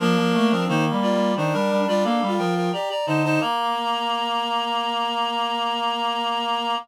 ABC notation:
X:1
M:5/4
L:1/16
Q:1/4=88
K:Bb
V:1 name="Clarinet"
[DB]4 [Ec] z [Fd]2 [Ec] [DB]2 [Fd] [Af]2 [Bg] [Bg] [db] [db] [ca] [ca] | b20 |]
V:2 name="Clarinet"
B,3 C B,4 (3D4 D4 F4 G z E E | B,20 |]
V:3 name="Clarinet"
F, F, A, F, (3E,2 G,2 G,2 E, G, G, G, B, G, F,2 z2 D,2 | B,20 |]